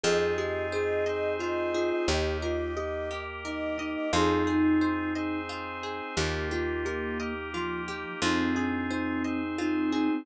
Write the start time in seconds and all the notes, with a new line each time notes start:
0.04 F2 C4 D#4 F4 G#4 D#5
0.38 G4 G#4
0.72 G#4 C5
1.06 C4 D#4 G#4 C5 D#5
1.39 F4 D#5
1.74 F4 G#4
1.91 D#5
2.08 D#2 A#3 D#4 G4 D#5
2.42 F4 A#4
2.77 G4 D#5
3.11 A#3 G4 A#4
3.44 D#4 A#4 D#5
3.78 D#4 D#5
3.95 D#5
4.12 F2 C4 D#4 F4 G#4
4.47 D#4 G#4
4.81 C5
5.15 C4 D#4 G#4 C5 D#5
5.49 F4
5.83 G#4
6.17 D#2 A#3 D#4 F4 G4
6.51 F4 G4
6.85 G4 A#4
7.20 A#3 D#4 G4 A#4 D#5
7.53 F3 F4
7.88 G4
8.22 F2 C4 D#4 F4 G#4
8.56 D4 G#4
8.90 D#4 C5
9.24 C4 D#4 G#4 C5 D#5
9.58 C4 D#4 F4
9.92 D#4 G#4
10.10 C4